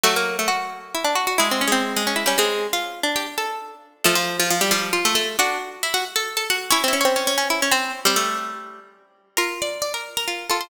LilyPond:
<<
  \new Staff \with { instrumentName = "Harpsichord" } { \time 3/4 \key bes \lydian \tempo 4 = 135 <fis fis'>2. | \tuplet 3/2 { <aes aes'>4 <aes aes'>4 <aes aes'>4 } <g g'>16 <aes aes'>8. | r4 <g' g''>16 r16 <a' a''>4 r8 | <a a'>16 <f f'>8 <f f'>16 <f f'>16 <g g'>16 <f f'>8. <a a'>16 <a a'>8 |
<d' d''>8 r8 <e' e''>16 <fis' fis''>16 r16 <a' a''>8 <a' a''>16 <fis' fis''>8 | \tuplet 3/2 { <des' des''>8 <fes' fes''>8 <des' des''>8 } <des' des''>16 <des' des''>4 <c' c''>8 r16 | <c' c''>16 <a a'>4.~ <a a'>16 r4 | \key c \lydian <bes' bes''>8 <d'' d'''>8 <d'' d'''>16 <bes' bes''>8 <bes' bes''>8. <a' a''>16 <c'' c'''>16 | }
  \new Staff \with { instrumentName = "Pizzicato Strings" } { \time 3/4 \key bes \lydian a16 bes8 a16 fis'4 e'16 d'16 fis'16 fis'16 | fes'16 c'16 des'16 c'8. des'16 fes'16 des'16 c'8. | f'8. d'4~ d'16 r4 | f4. g8 f'4 |
fis'2. | fes'16 c'16 des'16 c'8. des'16 fes'16 des'16 c'8. | g2~ g8 r8 | \key c \lydian f'2 f'8 f'8 | }
>>